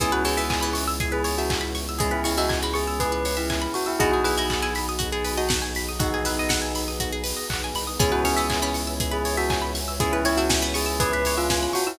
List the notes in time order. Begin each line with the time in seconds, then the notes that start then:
0.00 C#2 E3 B3 C#4 E4 G#4, kick, closed hi-hat
0.12 F#4 B4
0.25 E3 G#4 C#5, open hi-hat
0.37 E3 E5
0.50 G#5, kick, clap
0.61 E3 B5
0.73 C#6, open hi-hat
0.88 E6
1.00 G#4, kick, closed hi-hat
1.12 G#4 B4
1.24 C#5, open hi-hat
1.38 F#4 E5
1.50 G#5, kick, clap
1.61 B5
1.75 C#6, open hi-hat
1.89 E6
1.99 G#3 B3 C#4 E4 G#4, kick, closed hi-hat
2.11 E4 B4
2.24 G#3 E4 C#5, open hi-hat
2.38 G#3 F#4 E5
2.49 G#5, kick, clap
2.62 G#3 B5
2.74 G#4 C#6, open hi-hat
2.88 E6
3.00 G#4 B4, kick, closed hi-hat
3.12 B4
3.25 C#5, open hi-hat
3.37 E4 E5
3.50 G#5, kick, clap
3.62 B5
3.74 F#4 C#6, open hi-hat
3.86 E4 E6
3.99 B1 B3 D#4 F#4 G#4, kick, closed hi-hat
4.12 F#4 G#4
4.24 E4 G#4 B4, open hi-hat
4.38 E4 D#5
4.50 F#5, kick, clap
4.62 E4 G#5
4.75 B5, open hi-hat
4.89 D#6
4.99 F#4, kick, closed hi-hat
5.12 G#4
5.24 B4, open hi-hat
5.38 F#4 D#5
5.49 F#5, kick, snare
5.62 G#5
5.75 B5, open hi-hat
5.89 D#6
5.99 B3 D#4 F#4 G#4 B4, kick, closed hi-hat
6.14 G#4
6.25 E4 B4, open hi-hat
6.39 D#5
6.49 F#5, kick, snare
6.62 G#5
6.75 B5, open hi-hat
6.88 D#6
7.00 F#4, kick, closed hi-hat
7.12 G#4
7.24 B4, open hi-hat
7.36 D#5
7.50 B1 F#5, kick, clap
7.64 G#5
7.75 C2 B5, open hi-hat
7.87 D#6
7.99 C#2 B3 C#4 E4 G#4 B4 C#5 E5 G#5, kick, closed hi-hat
8.12 F#4 B4
8.24 C#4 G#4 C#5, open hi-hat
8.36 C#4 E5
8.50 G#5, kick, clap
8.62 C#4 B5
8.74 C#6, open hi-hat
8.87 E6
9.00 G#4, kick, closed hi-hat
9.11 G#4 B4
9.25 C#5, open hi-hat
9.37 F#4 E5
9.50 G#5, kick, clap
9.62 B5
9.75 C#6, open hi-hat
9.88 E6
10.00 B3 C#4 E4 G#4, kick, closed hi-hat
10.12 E4 B4
10.25 E4 C#5, open hi-hat
10.37 E4 F#4 E5
10.49 G#5, kick, snare
10.62 B3 B5
10.74 G#4 C#6, open hi-hat
10.86 E6
11.00 G#4 B4, kick, closed hi-hat
11.13 B4
11.25 C#5, open hi-hat
11.38 F4 E5
11.50 G#5, kick, snare
11.63 B5
11.73 F#4 C#6, open hi-hat
11.87 E4 E6